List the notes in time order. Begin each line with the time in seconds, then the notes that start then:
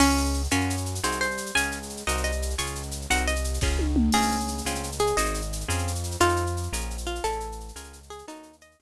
0.00 C#2 C#4 F4 G#4, crash
0.10 shaker
0.17 shaker
0.25 shaker
0.34 shaker
0.44 shaker
0.51 F#2 C#4 F4 F#4 A#4, shaker
0.60 shaker
0.70 shaker
0.77 shaker
0.86 shaker
0.95 shaker
1.03 C2 C4 D#4 F#4 G#4 C5, shaker
1.12 shaker
1.21 C5, shaker
1.31 shaker
1.37 shaker
1.46 shaker
1.55 C#2 C#4 F4 G#4 G#5, shaker
1.63 shaker
1.71 shaker
1.83 shaker
1.89 shaker
1.97 shaker
2.07 C2 C4 D#4 F#4 A#4 D#5, shaker
2.17 shaker
2.24 D#5, shaker
2.32 shaker
2.42 shaker
2.50 shaker
2.58 C#2 C#4 F4 G#4 C#6, shaker
2.66 shaker
2.75 shaker
2.83 shaker
2.91 shaker
3.01 shaker
3.10 C2 C4 D#4 F#4 A#4 F#5, shaker
3.17 shaker
3.28 D#5, shaker
3.36 shaker
3.44 shaker
3.54 shaker
3.61 C#2 C#4 F4 G#4, kick, snare
3.79 high tom
3.96 mid tom
4.12 C#2 C4 C#4 F4 G#4, crash
4.22 shaker
4.31 shaker
4.40 shaker
4.48 shaker
4.58 shaker
4.65 C#2 C4 C#4 F4 G#4, shaker
4.75 shaker
4.83 shaker
4.92 shaker
4.99 G#4, shaker
5.07 shaker
5.17 G#1 C4 D#4 F#4 G#4 D#5, shaker
5.26 shaker
5.34 shaker
5.41 shaker
5.53 shaker
5.61 shaker
5.68 F2 C4 C#4 F4 G#4, shaker
5.78 shaker
5.87 shaker
5.95 shaker
6.03 shaker
6.11 shaker
6.20 F2 C4 D#4 F4 A4, shaker
6.29 shaker
6.36 shaker
6.46 shaker
6.57 shaker
6.63 shaker
6.72 A#1 C#4 F4 G#4 A#4, shaker
6.80 shaker
6.90 shaker
6.98 shaker
7.07 F4, shaker
7.15 shaker
7.24 A1 C#4 E4 G#4 A4, shaker
7.32 shaker
7.40 shaker
7.52 shaker
7.60 shaker
7.68 shaker
7.75 C#2 C#4 F4 G#4 A#4, shaker
7.84 shaker
7.93 shaker
8.03 shaker
8.10 G#4, shaker
8.18 shaker
8.28 D#2 C#4 D#4 F#4 A4, shaker
8.35 shaker
8.43 shaker
8.53 shaker
8.61 D#5, shaker
8.71 shaker
8.79 C#2 C4 C#4 F4 G#4, shaker